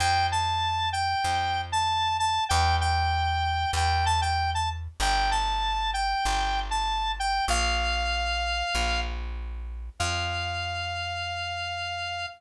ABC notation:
X:1
M:4/4
L:1/16
Q:1/4=96
K:F
V:1 name="Lead 1 (square)"
g2 a4 g5 a3 a2 | g2 g6 g2 a g2 a z2 | g2 a4 g5 a3 g2 | f10 z6 |
f16 |]
V:2 name="Electric Bass (finger)" clef=bass
F,,8 F,,8 | E,,8 E,,8 | G,,,8 G,,,8 | B,,,8 B,,,8 |
F,,16 |]